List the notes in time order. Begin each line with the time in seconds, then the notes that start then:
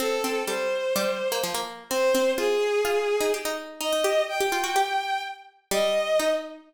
0.00 C4 A4
0.24 C4
0.47 G3 C5
0.96 G3
1.32 A#3
1.44 F3
1.54 A#3
1.90 C4 C5
2.15 C4
2.38 F4 G#4
2.85 F4
3.21 D#4
3.34 G4
3.45 D#4
3.80 D#4 D#5
3.93 D#4
4.04 G4
4.28 G5
4.40 G4
4.52 F4
4.64 F#4
4.76 G4
5.71 G3 D#5
6.19 D#4